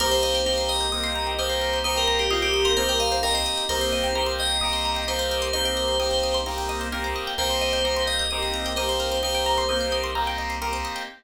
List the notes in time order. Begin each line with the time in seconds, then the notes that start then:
0.00 C2 A#3 C4 D#4 G4 A#4 C5
0.11 C5
0.23 D#5
0.35 G5
0.45 A#3 C4 D#4 G4 A#5
0.58 C6
0.69 D#5 D#6
0.81 G6
0.92 A#3 C4 D#4 G4 D#6
1.04 C6
1.15 A#5
1.27 G5
1.38 A#3 C4 D#4 G4 C5 D#5
1.50 C5
1.61 A#4
1.73 C5
1.84 A#3 C4 D#4 G4 C5 D#5
1.96 A#4 G5
2.07 A#5
2.19 G4 C6
2.31 A#3 C4 D#4 F4 G4 D#6
2.42 G4 G6
2.54 D#6
2.65 A#4 C6
2.77 A#3 C4 D#4 G4 C5 A#5
2.88 A#4 G5
3.00 D#5 F5
3.12 C5
3.23 A#3 C4 D#4 G4 A#4 D#5
3.34 C5 D#5
3.46 D#5
3.57 G5
3.69 C2 A#3 C4 D#4 G4 A#4 C5
3.81 C5
3.92 D#5
4.04 G5
4.15 A#3 C4 D#4 G4 A#5
4.26 C6
4.39 D#5 D#6
4.50 G6
4.61 A#3 C4 D#4 G4 D#6
4.73 C6
4.85 A#5
4.96 G5
5.07 A#3 C4 D#4 G4 C5 D#5
5.19 C5
5.31 A#4
5.42 C5
5.53 A#3 C4 D#4 G4 C5 D#5
5.65 G5
5.77 A#5
5.88 C6
5.99 A#3 C4 D#4 G4 D#6
6.11 G6
6.23 D#6
6.34 C6
6.46 A#3 C4 D#4 G4 A#5
6.58 G5
6.69 D#5
6.81 C5
6.92 A#3 C4 D#4 G4 A#4
7.04 C5
7.16 D#5
7.27 G5
7.38 C2 A#3 C4 D#4 G4 A#4 C5
7.50 C5
7.61 D#5
7.73 G5
7.84 A#3 C4 D#4 G4 A#5
7.96 C6
8.07 D#5 D#6
8.19 G6
8.31 A#3 C4 D#4 G4 D#6
8.42 C6
8.54 A#5
8.66 G5
8.76 A#3 C4 D#4 G4 C5 D#5
8.89 C5
9.00 A#4
9.12 C5
9.22 A#3 C4 D#4 G4 C5 D#5
9.35 G5
9.46 A#5
9.58 C6
9.69 A#3 C4 D#4 G4 D#6
9.81 G6
9.92 D#6
10.04 C6
10.15 A#3 C4 D#4 G4 A#5
10.27 G5
10.38 D#5
10.50 C5
10.61 A#3 C4 D#4 G4 A#4
10.73 C5
10.85 D#5
10.96 G5